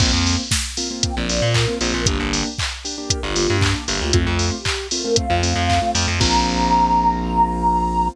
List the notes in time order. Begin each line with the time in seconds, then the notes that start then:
0.00 A#1 A#3 C4 F4, kick, crash
0.13 F2
0.26 open hi-hat
0.51 kick, snare
0.77 A#3 C4 F4, open hi-hat
0.91 A#3 C4 F4
1.02 G5, kick, closed hi-hat
1.16 A#1 A#3 C4 F4 D5
1.29 A#3 C4 F4, open hi-hat
1.42 A#2
1.54 A#4, kick, clap
1.68 A#3 C4 F4
1.81 A#1 A#3 C4 F4, open hi-hat
1.94 A#1 A#4
2.06 G1 A#3 D4 G4, kick, closed hi-hat
2.20 G1
2.33 open hi-hat
2.59 kick, clap
2.85 A#3 D4 G4, open hi-hat
2.98 A#3 D4 G4
3.09 A#4, kick, closed hi-hat
3.23 G1 A#3 D4 F4 G4
3.36 A#3 D4 G4, open hi-hat
3.50 G2
3.60 D4, kick, clap
3.75 A#3 D4 G4
3.88 G1 A#3 D4 G4, open hi-hat
4.01 D2 F4
4.12 F2 A3 C4 F4, kick, closed hi-hat
4.27 F2
4.39 open hi-hat
4.51 G4
4.65 kick, clap
4.91 A3 C4 F4 A#4, open hi-hat
5.05 A3 C4 F4
5.16 F5, kick, closed hi-hat
5.30 F2 A3 C4 F4
5.43 A3 C4 F4, open hi-hat
5.56 F2
5.70 kick, clap
5.82 A3 C4 F4
5.95 F2 A3 C4 F4, open hi-hat
6.08 F2
6.20 A#1 A#3 C4 F4 A#5, kick, crash